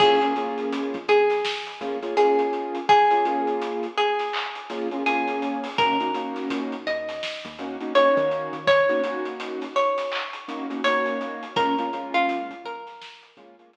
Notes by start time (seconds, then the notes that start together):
0.00 A#1 A#3 C#4 F4 G#4, kick, crash
0.21 A#3 C#4 F4 G#4, closed hi-hat
0.36 A#3 C#4 F4 G#4, closed hi-hat
0.58 closed hi-hat
0.73 closed hi-hat
0.94 A#1, closed hi-hat
1.08 A#1 G#4, closed hi-hat
1.30 snare, closed hi-hat
1.45 snare
1.66 closed hi-hat
1.81 A#1 A#3 C#4 F4 G#4, closed hi-hat
2.02 A#3 C#4 F4 G#4, closed hi-hat
2.17 A#3 C#4 F4 G#4, closed hi-hat
2.39 closed hi-hat
2.53 closed hi-hat
2.75 closed hi-hat
2.89 G#4, kick, closed hi-hat
3.11 A#3 C#4 F4 G#4, closed hi-hat
3.25 A#3 C#4 F4 G#4, closed hi-hat
3.47 closed hi-hat
3.62 closed hi-hat
3.83 closed hi-hat
3.98 G#4, closed hi-hat
4.19 snare, closed hi-hat
4.33 clap
4.55 closed hi-hat
4.70 A#3 C#4 F4 G#4, snare, closed hi-hat
4.91 A#3 C#4 F4 G#4, closed hi-hat
5.06 A#3 C#4 F4 G#4, closed hi-hat
5.28 closed hi-hat
5.42 closed hi-hat
5.64 open hi-hat
5.78 D#2 A#3 C#4 D#4 F#4 A#4, kick, closed hi-hat
6.00 A#3 C#4 D#4 F#4, closed hi-hat
6.14 A#3 C#4 D#4 F#4, closed hi-hat
6.36 snare, closed hi-hat
6.50 A#2, closed hi-hat
6.72 closed hi-hat
6.87 D#2 D#5, closed hi-hat
7.09 snare, closed hi-hat
7.23 snare
7.44 D#2, closed hi-hat
7.59 A#3 C#4 D#4 F#4, closed hi-hat
7.81 A#3 C#4 D#4 F#4, closed hi-hat
7.95 A#3 C#4 D#4 F#4 C#5, closed hi-hat
8.17 D#3, closed hi-hat
8.31 closed hi-hat
8.53 D#3, closed hi-hat
8.67 C#5, kick, closed hi-hat
8.89 A#3 C#4 D#4 F#4, closed hi-hat
9.04 A#3 C#4 D#4 F#4, closed hi-hat
9.25 closed hi-hat
9.40 closed hi-hat
9.61 snare, closed hi-hat
9.76 C#5, closed hi-hat
9.98 snare, closed hi-hat
10.12 clap
10.33 closed hi-hat
10.48 A#3 C#4 D#4 F#4, closed hi-hat
10.70 A#3 C#4 D#4 F#4, closed hi-hat
10.84 A#3 C#4 D#4 F#4 C#5, closed hi-hat
11.06 closed hi-hat
11.21 closed hi-hat
11.43 closed hi-hat
11.56 A#1 G#3 A#3 C#4 F4 A#4, kick, closed hi-hat
11.78 G#3 A#3 C#4 F4, closed hi-hat
11.93 G#3 A#3 C#4 F4, closed hi-hat
12.14 F4, closed hi-hat
12.29 closed hi-hat
12.50 A#1, closed hi-hat
12.64 A#1 A#4, closed hi-hat
12.87 snare, closed hi-hat
13.02 snare
13.23 closed hi-hat
13.37 A#1 G#3 A#3 C#4 F4, closed hi-hat
13.59 G#3 A#3 C#4 F4, closed hi-hat
13.73 G#3 A#3 C#4 F4, closed hi-hat